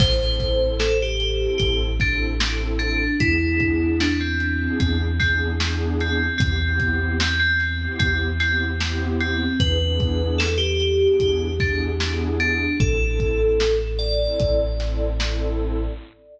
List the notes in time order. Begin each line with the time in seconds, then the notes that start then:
0.00 A1 C4 E4 A4 C5, kick, crash
0.20 C4 E4 A4
0.40 kick, snare, closed hi-hat
0.79 A4, snare
1.02 G4
1.20 closed hi-hat
1.41 C4 E4 A4
1.58 A1 G4, kick, closed hi-hat
2.00 C4 D4 E4 A4, kick, snare, closed hi-hat
2.40 C4 E4 A4, snare
2.79 D4, closed hi-hat
3.20 E2 B3 D4 E4 G#4, kick, closed hi-hat
3.40 B3 D4 E4 G#4
3.60 kick, closed hi-hat
4.00 D4, snare
4.21 C4
4.40 closed hi-hat
4.59 B3 D4 E4 G#4
4.80 E2 C4, kick, closed hi-hat
5.20 B3 C4 D4 E4 G#4, kick, snare, closed hi-hat
5.60 B3 D4 E4 G#4, snare
6.00 C4, closed hi-hat
6.38 E2 B3 C4 E4 G4, kick, closed hi-hat
6.60 B3 C4 E4 G4
6.80 kick, closed hi-hat
7.20 C4, snare
7.40 C4
7.60 snare, closed hi-hat
7.81 B3 C4 E4 G4
7.99 E2 C4, kick, closed hi-hat
8.39 B3 C4 E4 G4, snare, closed hi-hat
8.80 B3 C4 E4 G4, snare
9.21 C4, closed hi-hat
9.60 E2 B3 D4 E4 G#4 B4, kick, closed hi-hat
9.81 B3 D4 E4 G#4
10.00 kick, closed hi-hat
10.38 A4, snare
10.58 G4
10.80 closed hi-hat
11.01 B3 D4 E4 G#4
11.20 E2 G4, kick, closed hi-hat
11.60 B3 D4 E4 G#4, kick, snare, closed hi-hat
12.00 B3 D4 E4 G#4, snare
12.40 D4, closed hi-hat
12.80 A1 C4 E4 A4, kick, closed hi-hat
13.01 C4 E4 A4
13.20 kick, closed hi-hat
13.60 snare
13.99 D5, closed hi-hat
14.20 C4 E4 A4
14.40 A1, kick, closed hi-hat
14.79 C4 E4 A4, snare, closed hi-hat
15.20 C4 E4 A4, snare